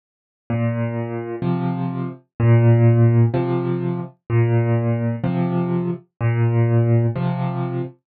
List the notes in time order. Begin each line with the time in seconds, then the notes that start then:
0.50 A#2
1.42 C3 F3
2.40 A#2
3.34 C3 F3
4.30 A#2
5.24 C3 F3
6.21 A#2
7.15 C3 F3